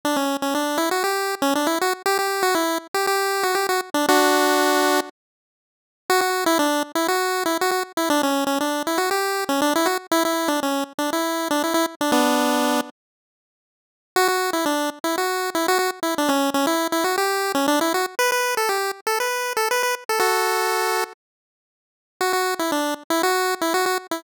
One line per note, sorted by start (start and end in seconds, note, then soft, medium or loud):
0.05 0.17 D4 medium
0.16 0.37 C#4 medium
0.42 0.54 C#4 medium
0.55 0.79 D4 medium
0.78 0.89 E4 medium
0.91 1.03 F#4 medium
1.04 1.35 G4 medium
1.42 1.54 C#4 medium
1.55 1.67 D4 medium
1.67 1.79 E4 medium
1.81 1.93 F#4 medium
2.06 2.18 G4 loud
2.19 2.43 G4 medium
2.43 2.55 F#4 loud
2.55 2.78 E4 medium
2.94 3.06 G4 medium
3.07 3.44 G4 medium
3.43 3.55 F#4 medium
3.55 3.67 G4 medium
3.69 3.81 F#4 medium
3.94 4.06 D4 medium
4.09 5.00 D4 loud
4.09 5.00 F#4 loud
6.10 6.21 F#4 loud
6.21 6.44 F#4 medium
6.46 6.58 E4 loud
6.59 6.83 D4 medium
6.95 7.07 E4 medium
7.08 7.44 F#4 medium
7.46 7.58 E4 medium
7.61 7.71 F#4 medium
7.71 7.83 F#4 medium
7.97 8.09 E4 medium
8.10 8.22 D4 loud
8.23 8.44 C#4 medium
8.47 8.59 C#4 medium
8.61 8.83 D4 medium
8.87 8.99 E4 medium
8.98 9.10 F#4 medium
9.11 9.44 G4 medium
9.49 9.61 C#4 medium
9.62 9.74 D4 loud
9.75 9.87 E4 loud
9.86 9.98 F#4 medium
10.11 10.23 E4 loud
10.25 10.49 E4 medium
10.48 10.60 D4 medium
10.63 10.84 C#4 medium
10.98 11.10 D4 medium
11.13 11.48 E4 medium
11.51 11.63 D4 medium
11.64 11.74 E4 medium
11.74 11.86 E4 loud
12.01 12.11 D4 medium
12.12 12.81 B3 medium
12.12 12.81 D4 medium
14.16 14.28 F#4 loud
14.28 14.51 F#4 medium
14.53 14.65 E4 medium
14.66 14.90 D4 medium
15.04 15.16 E4 medium
15.18 15.50 F#4 medium
15.55 15.67 E4 medium
15.68 15.78 F#4 loud
15.79 15.91 F#4 medium
16.03 16.15 E4 medium
16.18 16.30 D4 medium
16.29 16.50 C#4 medium
16.54 16.66 C#4 medium
16.67 16.88 E4 medium
16.92 17.04 E4 medium
17.04 17.16 F#4 medium
17.18 17.52 G4 medium
17.55 17.67 C#4 medium
17.68 17.80 D4 loud
17.81 17.93 E4 medium
17.94 18.06 F#4 medium
18.19 18.31 B4 loud
18.32 18.55 B4 medium
18.57 18.69 A4 medium
18.69 18.91 G4 medium
19.07 19.19 A4 medium
19.20 19.53 B4 medium
19.57 19.69 A4 medium
19.71 19.82 B4 medium
19.83 19.95 B4 medium
20.09 20.19 A4 medium
20.19 21.04 F#4 medium
20.19 21.04 A4 medium
22.21 22.33 F#4 medium
22.33 22.54 F#4 medium
22.59 22.71 E4 medium
22.72 22.94 D4 medium
23.10 23.22 E4 medium
23.23 23.55 F#4 loud
23.61 23.73 E4 medium
23.74 23.85 F#4 medium
23.86 23.98 F#4 medium
24.11 24.23 E4 medium